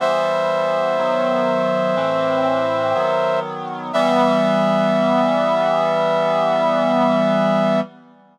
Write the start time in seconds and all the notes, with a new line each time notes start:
0.00 E3 G3 B3 C5 E5
0.98 D#3 F#3 B3
1.96 A2 E3 C4
2.95 D#3 F#3 B3
3.93 E3 G3 B3 E5